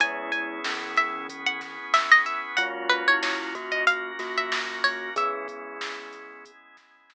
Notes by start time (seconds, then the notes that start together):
0.00 C#2 G#3 B3 C#4 E4 G#4 G#5, kick, closed hi-hat
0.32 G#5, kick, closed hi-hat
0.64 C#2 E3 C#4, snare
0.97 E5, closed hi-hat
1.15 C#2
1.29 B3 C#4 G#4 B4, kick, closed hi-hat
1.46 F#5
1.61 kick, snare, closed hi-hat
1.80 C#2
1.94 E5, snare
2.12 C#2 D#5
2.26 E5, closed hi-hat
2.57 F#2 G#3 A#3 C#4 F4 F#4 F#5, kick, closed hi-hat
2.90 B4, closed hi-hat
3.08 E4 C#5
3.23 F#2 C#5, snare
3.55 A#3 F#4, kick, closed hi-hat
3.72 F#2 D#5
3.87 A#3 C#4 F#4 A#4 F5, kick, closed hi-hat
4.19 A#3 F#4, snare, closed hi-hat
4.38 F#2 E5
4.52 snare
4.70 F#2
4.84 C#2 C#5, open hi-hat
5.16 G#3 B3 C#4 E4 G#4 E5, kick, closed hi-hat
5.48 kick, closed hi-hat
5.81 C#2, snare
6.13 closed hi-hat
6.31 C#2
6.45 G#3 B3 E4 G#4, kick, closed hi-hat
6.77 kick, snare, closed hi-hat
6.96 C#2
7.10 snare